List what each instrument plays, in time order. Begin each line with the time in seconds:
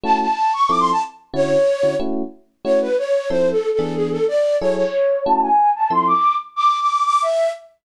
0.04 electric piano 1 A3 C#4 E4 F#4, flute A5
0.20 flute A5
0.53 flute C#6
0.69 electric piano 1 F3 C4 E4 A4, flute D6
0.79 flute C6
0.92 flute A5
1.34 electric piano 1 D3 C#4 E4 F#4, flute C#5
1.83 electric piano 1 D3 C#4 E4 F#4
2.00 electric piano 1 A3 C#4 E4 F#4
2.65 electric piano 1 A3 C#4 E4 F#4, flute C#5
2.81 flute B4
2.98 flute C#5
3.30 electric piano 1 F3 C4 E4 A4, flute C5
3.52 flute A4
3.73 flute A4
3.79 electric piano 1 E3 B3 D4 G#4
3.95 flute G#4
4.11 flute A4
4.28 flute D5
4.60 electric piano 1 F#3 E4 G#4 A4, flute C#5
4.76 flute C#5
5.25 electric piano 1 A3 C#4 E4 F#4, flute A5
5.42 flute G#5
5.76 flute A5
5.90 electric piano 1 F3 C4 E4 A4, flute C6
6.07 flute D6
6.56 flute D6
6.81 flute D6
7.05 flute D6
7.22 flute E5